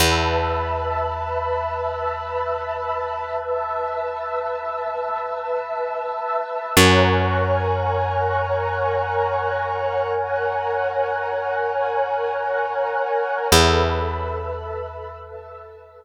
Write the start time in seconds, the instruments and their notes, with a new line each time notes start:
0.00 electric bass (finger) E2, pad 2 (warm) B4 E5 A5 B5 E6
3.38 pad 2 (warm) E5 A5 E6
6.76 electric bass (finger) F#2, pad 2 (warm) A#4 C#5 F#5 G#5 A#5 C#6 F#6
10.14 pad 2 (warm) F#5 G#5 A#5 F#6
13.52 electric bass (finger) E2, pad 2 (warm) A4 B4 E5 A5 B5 E6
15.21 pad 2 (warm) E5 A5 E6